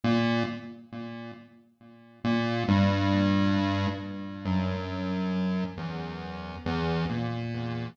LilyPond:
\new Staff { \clef bass \time 9/8 \tempo 4. = 45 ais,8 r2 ais,8 g,4. | r8 fis,4. e,4 e,8 ais,4 | }